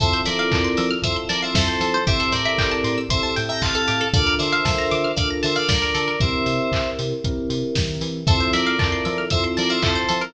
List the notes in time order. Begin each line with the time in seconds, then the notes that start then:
0.00 F2 C4 E4 F4 A4 C5 E5, kick, closed hi-hat
0.13 C5
0.25 F3 A#4 D5 E5, open hi-hat
0.39 F5
0.52 F2 A5, kick, clap
0.64 C6
0.77 F3 E6, open hi-hat
0.91 F6
1.02 F2 C4 E4 F4 A4 C5 E5 E6, kick, closed hi-hat
1.16 C6
1.29 F3 A#4 D5 A5, open hi-hat
1.42 C5 E5 F5
1.54 F2 A4 C5 E5, kick, snare
1.68 C5
1.80 F3 A4, open hi-hat
1.94 C5
2.07 A1 C4 E4 G4 A4 C5 E5, kick, closed hi-hat
2.20 A4
2.32 A2 A#4 C5 D5, kick, open hi-hat
2.45 E5
2.58 A1 G5, kick, clap
2.71 A5
2.84 A2 C6, open hi-hat
2.98 E6
3.09 A1 C4 E4 G4 A4 C5 E5 C6, kick, closed hi-hat
3.23 C5 E5 A5
3.36 A2 G5, open hi-hat
3.49 E5 G5 A#5
3.61 A1 C5 F5 A5, kick, clap
3.75 A4
3.88 A2 G4, open hi-hat
4.01 A4
4.13 D2 D4 F4 A4 A#4 D5 F5, kick, closed hi-hat
4.27 A#4
4.39 D3 C5 D5 E5, open hi-hat
4.52 F5
4.65 D2 A5, kick, snare
4.78 A#5
4.91 D3 D6, open hi-hat
5.04 F6
5.16 D2 D4 F4 A4 A#4 D5 F5 D6, kick, closed hi-hat
5.30 A#5
5.43 D3 C5 E5 A5, open hi-hat
5.55 D5 F5
5.69 D2 A#4 D5, kick, snare
5.82 A#4
5.95 D3 A4, open hi-hat
6.08 A#4
6.20 C2 C4 E4 G4 A#4 C5 E5, kick, closed hi-hat
6.46 C3, open hi-hat
6.72 C2, kick, clap
6.99 C3, open hi-hat
7.24 C2 C4 E4 G4 A#4, kick, closed hi-hat
7.49 C3, open hi-hat
7.75 D#3, kick, snare
8.01 E3, open hi-hat
8.27 F2 C4 E4 F4 A4 C5 E5, kick, closed hi-hat
8.40 C5
8.53 F3 A#4 D5 E5, open hi-hat
8.66 F5
8.79 F2 C4 E4 F4 A4 A5, kick, clap
8.92 C6
9.05 F3 E6, open hi-hat
9.18 F6
9.30 F2 C4 E4 F4 A4 C5 E5 E6, kick, closed hi-hat
9.44 C6
9.57 F3 A#4 D5 A5, open hi-hat
9.70 C5 E5 F5
9.82 F2 C4 E4 F4 A4 C5 E5, kick, clap
9.95 C5
10.09 F3 A4, open hi-hat
10.21 A#4